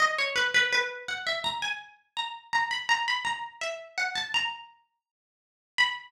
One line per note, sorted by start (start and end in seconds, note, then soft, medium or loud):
0.00 0.16 D#5 medium
0.18 0.35 C#5 medium
0.36 0.53 B4 medium
0.54 0.72 B4 medium
0.73 1.05 B4 medium
1.08 1.26 F#5 medium
1.27 1.42 E5 medium
1.44 1.60 A#5 medium
1.62 1.79 G#5 medium
2.17 2.52 A#5 medium
2.53 2.70 A#5 medium
2.71 2.88 B5 medium
2.89 3.04 A#5 loud
3.08 3.25 B5 medium
3.25 3.58 A#5 medium
3.61 3.93 E5 medium
3.98 4.14 F#5 medium
4.15 4.31 A5 medium
4.34 5.07 A#5 medium
5.78 6.11 B5 loud